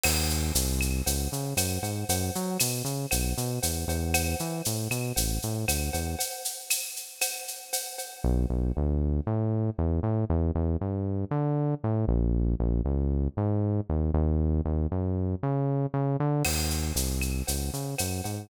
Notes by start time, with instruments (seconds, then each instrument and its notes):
0.04 synth bass 1 D#2, crash, cowbell, claves
0.30 shaker
0.55 synth bass 1 C2, shaker
0.81 claves, shaker
1.06 synth bass 1 C#2, cowbell, shaker
1.32 synth bass 1 C#3, shaker
1.57 synth bass 1 F#2, cowbell, claves, shaker
1.83 synth bass 1 G#2, cowbell, shaker
2.09 synth bass 1 F#2, cowbell, shaker
2.35 synth bass 1 F#3, shaker
2.60 synth bass 1 B2, claves, shaker
2.85 synth bass 1 C#3, shaker
3.11 synth bass 1 B1, cowbell, claves, shaker
3.37 synth bass 1 B2, shaker
3.63 synth bass 1 E2, cowbell, shaker
3.88 synth bass 1 E2, cowbell, shaker
4.14 cowbell, claves, shaker
4.39 synth bass 1 E3, shaker
4.65 synth bass 1 A2, shaker
4.91 synth bass 1 B2, claves, shaker
5.16 synth bass 1 A1, cowbell, shaker
5.42 synth bass 1 A2, shaker
5.68 synth bass 1 D2, cowbell, claves, shaker
5.93 synth bass 1 E2, cowbell, shaker
6.19 cowbell, shaker
6.45 shaker
6.70 claves, shaker
6.96 shaker
7.21 cowbell, claves, shaker
7.48 shaker
7.73 cowbell, shaker
7.98 cowbell, shaker
8.24 synth bass 1 B1
8.50 synth bass 1 B1
8.77 synth bass 1 D2
9.27 synth bass 1 A2
9.78 synth bass 1 E2
10.03 synth bass 1 A2
10.30 synth bass 1 E2
10.55 synth bass 1 E2
10.81 synth bass 1 G2
11.31 synth bass 1 D3
11.84 synth bass 1 A2
12.08 synth bass 1 A#1
12.60 synth bass 1 A#1
12.85 synth bass 1 C#2
13.37 synth bass 1 G#2
13.90 synth bass 1 D#2
14.14 synth bass 1 D#2
14.65 synth bass 1 D#2
14.92 synth bass 1 F#2
15.43 synth bass 1 C#3
15.94 synth bass 1 C#3
16.20 synth bass 1 D3
16.45 synth bass 1 D#2, crash, cowbell, claves
16.70 shaker
16.96 synth bass 1 C2, shaker
17.21 claves, shaker
17.47 synth bass 1 C#2, cowbell, shaker
17.73 synth bass 1 C#3, shaker
17.98 synth bass 1 F#2, cowbell, claves, shaker
18.24 synth bass 1 G#2, cowbell, shaker